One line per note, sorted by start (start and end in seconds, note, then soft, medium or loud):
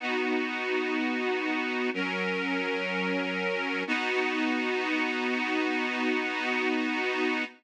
0.00 1.90 B3 medium
0.00 1.90 D#4 medium
0.00 1.90 F#4 medium
1.94 3.83 F#3 medium
1.94 3.83 C#4 medium
1.94 3.83 A#4 medium
3.87 7.44 B3 loud
3.87 7.44 D#4 loud
3.87 7.44 F#4 loud